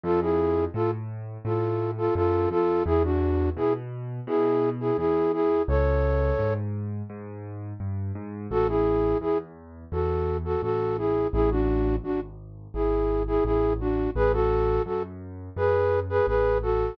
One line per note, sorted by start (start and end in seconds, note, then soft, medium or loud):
0.03 0.67 F2 medium
0.03 0.20 F4 medium
0.03 0.20 A4 medium
0.21 0.65 E4 medium
0.21 0.65 G#4 medium
0.74 1.37 A2 medium
0.74 0.91 F4 medium
0.74 0.91 A4 medium
1.45 2.08 A2 medium
1.45 1.91 F4 soft
1.45 1.91 A4 medium
1.98 2.14 F4 medium
1.98 2.14 A4 medium
2.15 2.47 F#2 medium
2.15 2.49 F4 medium
2.15 2.49 A4 medium
2.51 2.82 F2 medium
2.51 2.83 F4 medium
2.51 2.83 A4 medium
2.86 3.49 E2 medium
2.86 3.03 E4 medium
2.86 3.03 G#4 medium
3.04 3.50 D4 medium
3.04 3.50 F#4 medium
3.56 4.20 B2 medium
3.56 3.73 E4 medium
3.56 3.73 G#4 medium
4.27 4.91 B2 medium
4.27 4.70 E4 medium
4.27 4.70 G#4 medium
4.80 4.97 E4 medium
4.80 4.97 G#4 medium
4.98 5.61 E2 medium
4.98 5.32 E4 medium
4.98 5.32 G#4 medium
5.33 5.62 E4 medium
5.33 5.62 G#4 medium
5.68 6.32 C#2 medium
5.68 6.54 A4 medium
5.68 6.54 C#5 medium
6.39 7.02 G#2 medium
7.10 7.73 G#2 medium
7.80 8.12 G2 medium
8.15 8.47 G#2 medium
8.51 9.14 A1 medium
8.51 8.67 F#4 medium
8.51 8.67 A4 medium
8.68 9.18 E4 medium
8.68 9.18 G#4 medium
9.21 9.85 E2 medium
9.21 9.38 E4 medium
9.21 9.38 G#4 medium
9.92 10.55 E2 medium
9.92 10.37 F#4 medium
9.92 10.37 A4 medium
10.45 10.61 F#4 medium
10.45 10.61 A4 medium
10.62 11.26 A1 medium
10.62 10.97 F#4 medium
10.62 10.97 A4 medium
10.98 11.27 E4 medium
10.98 11.27 G#4 medium
11.33 11.97 A1 medium
11.33 11.50 E4 medium
11.33 11.50 G#4 medium
11.51 11.96 D4 medium
11.51 11.96 F#4 medium
12.04 12.67 G#1 medium
12.04 12.20 D4 medium
12.04 12.20 F#4 medium
12.74 13.38 G#1 medium
12.74 13.23 E4 medium
12.74 13.23 G#4 medium
13.27 13.44 E4 medium
13.27 13.44 G#4 medium
13.45 14.08 A1 medium
13.45 13.73 E4 medium
13.45 13.73 G#4 medium
13.80 14.10 D4 medium
13.80 14.10 F#4 medium
14.15 14.79 A1 medium
14.15 14.32 G#4 medium
14.15 14.32 B4 medium
14.33 14.82 F#4 medium
14.33 14.82 A4 medium
14.86 15.49 F#2 medium
14.86 15.03 F#4 medium
14.86 15.03 A4 medium
15.56 16.20 F#2 medium
15.56 16.00 G#4 medium
15.56 16.00 B4 medium
16.09 16.26 G#4 medium
16.09 16.26 B4 medium
16.27 16.91 A1 medium
16.27 16.58 G#4 medium
16.27 16.58 B4 medium
16.62 16.95 F#4 medium
16.62 16.95 A4 medium